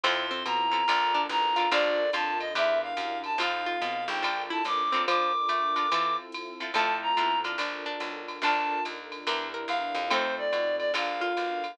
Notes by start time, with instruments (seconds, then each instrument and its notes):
0.03 electric bass (finger) F2, pizzicato strings C4, acoustic guitar (steel) C4 E4 F4 A4, string ensemble 1 C4 E4 F4 A4, clarinet C6, ride
0.31 pizzicato strings C4
0.45 electric bass (finger) B2, clarinet A#5, hi-hat pedal, ride
0.72 acoustic guitar (steel) C4 E4 F4 A4, ride
0.88 electric bass (finger) A#1, acoustic guitar (steel) D4 F4 A4 A#4, string ensemble 1 D4 F4 A4 A#4, ride
1.14 pizzicato strings D4
1.29 electric bass (finger) A1, clarinet A#5, kick, hi-hat pedal, ride
1.56 acoustic guitar (steel) D4 F4 A4 A#4, pizzicato strings F4, ride
1.72 electric bass (finger) A#1, acoustic guitar (steel) D4 F4 A4 A#4, string ensemble 1 D4 F4 A4 A#4, pizzicato strings D4 F4, clarinet D5, kick, ride
2.13 electric bass (finger) F2, pizzicato strings F4, clarinet A5, hi-hat pedal, ride
2.40 clarinet D#5, ride
2.55 electric bass (finger) E2, acoustic guitar (steel) D4 E4 G4 A#4, string ensemble 1 D4 E4 G4 A#4, clarinet E5, kick, ride
2.82 clarinet F5
2.97 electric bass (finger) F#2, kick, hi-hat pedal, ride
3.24 clarinet A5, ride
3.38 electric bass (finger) F2, string ensemble 1 C4 D#4 F4 A4, acoustic guitar (steel) C4 D#4 F4 A4, pizzicato strings F4, clarinet F5, kick, ride
3.66 pizzicato strings F4
3.81 electric bass (finger) B2, kick, hi-hat pedal, ride
4.08 electric bass (finger) A#1, clarinet G5, ride
4.23 acoustic guitar (steel) D4 F4 A4 A#4, string ensemble 1 D4 F4 A4 A#4, kick, ride
4.50 pizzicato strings E4, clarinet A5
4.65 electric bass (finger) A1, clarinet D6, kick, hi-hat pedal, ride
4.92 pizzicato strings C4, acoustic guitar (steel) D4 F4 A4 A#4, ride
5.08 pizzicato strings F3, string ensemble 1 D4 F4 A4 A#4, clarinet D6, ride
5.49 pizzicato strings A3, hi-hat pedal, ride
5.76 acoustic guitar (steel) D4 F4 A4 A#4, ride
5.91 pizzicato strings E3, string ensemble 1 C4 E4 F4 A4, acoustic guitar (steel) C4 E4 F4 A4, kick, ride
6.32 hi-hat pedal, ride
6.60 acoustic guitar (steel) C4 E4 F4 A4, ride
6.74 electric bass (finger) F2, pizzicato strings F3 A3, string ensemble 1 C4 E4 F4 A4, acoustic guitar (steel) C4 E4 F4 A4, clarinet A5, ride
7.02 clarinet A#5
7.17 electric bass (finger) B2, acoustic guitar (steel) C4 E4 F4 A4, hi-hat pedal, ride
7.44 acoustic guitar (steel) D4 F4 A4 A#4, ride
7.58 electric bass (finger) A#1, pizzicato strings D4, string ensemble 1 D4 F4 A4 A#4, ride
7.86 pizzicato strings D4
8.00 electric bass (finger) B1, hi-hat pedal, ride
8.28 ride
8.42 electric bass (finger) A#1, pizzicato strings D4 F4, string ensemble 1 D4 F4 A4 A#4, acoustic guitar (steel) D4 F4 A4 A#4, clarinet A5, ride
8.85 electric bass (finger) D#2, hi-hat pedal, ride
9.12 ride
9.27 electric bass (finger) E2, string ensemble 1 D4 E4 G4 A#4, acoustic guitar (steel) D4 E4 G4 A#4, pizzicato strings A#4, ride
9.54 pizzicato strings A#4
9.68 electric bass (finger) E2, clarinet F5, hi-hat pedal, ride
9.95 electric bass (finger) F2, ride
10.10 pizzicato strings A3 C4, string ensemble 1 C4 D#4 F4 A4, acoustic guitar (steel) C4 D#4 F4 A4, clarinet C5, ride
10.38 clarinet D5
10.53 electric bass (finger) B2, hi-hat pedal, ride
10.79 clarinet D5, ride
10.94 electric bass (finger) A#1, acoustic guitar (steel) D4 F4 A4 A#4, string ensemble 1 D4 F4 A4 A#4, pizzicato strings F4, clarinet F5, kick, ride
11.21 pizzicato strings F4
11.37 electric bass (finger) B1, hi-hat pedal, ride
11.64 ride